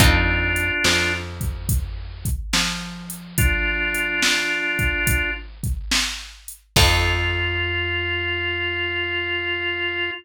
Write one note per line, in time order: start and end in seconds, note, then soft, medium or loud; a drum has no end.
0.00 0.71 F2 medium
0.00 0.76 C4 loud
0.00 1.13 D4 medium
0.00 0.76 D#4 loud
0.00 0.76 F4 loud
0.00 1.13 F4 medium
0.00 0.76 A4 loud
0.00 kick loud
0.00 closed hi-hat loud
0.56 closed hi-hat medium
0.84 2.29 F2 medium
0.84 2.28 F3 medium
0.84 snare loud
1.41 kick medium
1.41 closed hi-hat medium
1.69 kick loud
1.69 closed hi-hat loud
2.25 kick medium
2.25 closed hi-hat medium
2.53 6.13 F3 medium
2.53 6.12 F4 medium
2.53 snare loud
3.10 closed hi-hat medium
3.38 5.31 D4 medium
3.38 5.31 F4 medium
3.38 kick loud
3.38 closed hi-hat loud
3.95 closed hi-hat medium
4.22 snare loud
4.79 kick medium
4.79 closed hi-hat medium
5.07 kick loud
5.07 closed hi-hat loud
5.63 kick medium
5.63 closed hi-hat medium
5.91 snare loud
6.48 closed hi-hat medium
6.76 10.10 F2 loud
6.76 10.11 C4 medium
6.76 10.11 D#4 loud
6.76 10.10 F4 loud
6.76 10.11 F4 loud
6.76 10.11 A4 loud
6.76 kick loud
6.76 crash loud